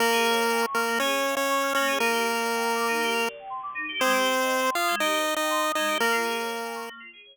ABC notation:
X:1
M:4/4
L:1/16
Q:1/4=120
K:Bbdor
V:1 name="Lead 1 (square)"
[B,B]6 [B,B]2 [Dd]3 [Dd]3 [Dd]2 | [B,B]12 z4 | [Cc]6 [Ff]2 [Ee]3 [Ee]3 [Ee]2 | [B,B]8 z8 |]
V:2 name="Electric Piano 2"
B, A d f a d' f' B, A d f a d' f' B, A | E G B =d g b =d' E G B d g c' d' E G | A, G c e g c' e' A, G c e g c' e' A, G | B, F A d f a d' B, F A d z5 |]